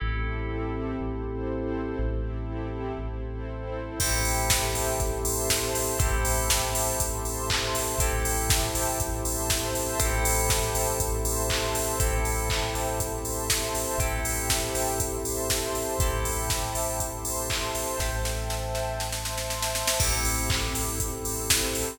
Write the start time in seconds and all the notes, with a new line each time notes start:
0.00 A1 C4 E4 G4 A4
0.99 A1 C4 E4 A4 C5
1.99 A1 C4 E4 G4 A4
2.98 A1 C4 E4 A4 C5
4.00 A1 C4 E4 G4 A4 C5 E5 G5 A5, kick, crash
4.25 open hi-hat
4.50 kick, snare
4.75 open hi-hat
5.00 A1 C5 E5 A5 C6, kick, closed hi-hat
5.25 open hi-hat
5.50 kick, snare
5.75 open hi-hat
5.99 A1 C4 E4 G4 A4 C5 E5 G5 A5, kick, closed hi-hat
6.25 open hi-hat
6.50 kick, snare
6.75 open hi-hat
7.00 A1 C5 E5 A5 C6, kick, closed hi-hat
7.25 open hi-hat
7.50 kick, clap
7.75 open hi-hat
7.98 A1 C4 E4 G4 A4 C5 E5 G5 A5, kick, closed hi-hat
8.25 open hi-hat
8.50 kick, snare
8.75 open hi-hat
9.00 A1 C5 E5 A5 C6, kick, closed hi-hat
9.25 open hi-hat
9.50 kick, snare
9.75 open hi-hat
10.00 A1 C4 E4 G4 A4 C5 E5 G5 A5, kick, closed hi-hat
10.25 open hi-hat
10.50 kick, snare
10.75 open hi-hat
11.00 A1 C5 E5 A5 C6, kick, closed hi-hat
11.25 open hi-hat
11.50 kick, clap
11.75 open hi-hat
12.00 A1 C4 E4 G4 A4 C5 E5 G5 A5, kick, closed hi-hat
12.25 open hi-hat
12.50 kick, clap
12.75 open hi-hat
13.00 C5 E5 A5 C6, kick, closed hi-hat
13.25 open hi-hat
13.50 kick, snare
13.75 open hi-hat
13.98 A1 C4 E4 G4 A4 C5 E5 G5 A5, kick, closed hi-hat
14.25 open hi-hat
14.50 kick, snare
14.75 open hi-hat
15.00 C5 E5 A5 C6, kick, closed hi-hat
15.25 open hi-hat
15.50 kick, snare
15.75 open hi-hat
15.99 A1 C4 E4 G4 A4 C5 E5 G5 A5, kick, closed hi-hat
16.25 open hi-hat
16.50 kick, snare
16.75 open hi-hat
17.00 C5 E5 A5 C6, kick, closed hi-hat
17.25 open hi-hat
17.50 kick, clap
17.75 open hi-hat
17.99 A1 A4 C5 E5 G5 A5, kick, snare
18.25 snare
18.50 snare
18.75 snare
19.00 C5 E5 A5 C6, snare
19.12 snare
19.25 snare
19.38 snare
19.50 snare
19.62 snare
19.75 snare
19.88 snare
20.00 A1 C4 E4 G4 A4 C5 E5 G5, kick, crash
20.25 open hi-hat
20.50 kick, clap
20.75 open hi-hat
21.00 C4 E4 A4 C5, kick, closed hi-hat
21.25 open hi-hat
21.50 kick, snare
21.75 open hi-hat